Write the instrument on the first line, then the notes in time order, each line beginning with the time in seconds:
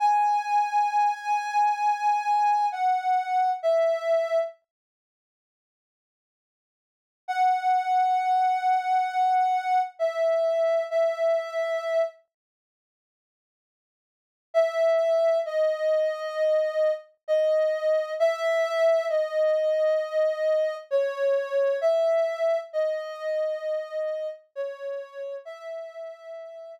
ocarina
0.00 G#5
2.72 F#5
3.63 E5
7.28 F#5
9.99 E5
10.90 E5
14.54 E5
15.46 D#5
17.28 D#5
18.20 E5
19.09 D#5
20.91 C#5
21.81 E5
22.73 D#5
24.55 C#5
25.45 E5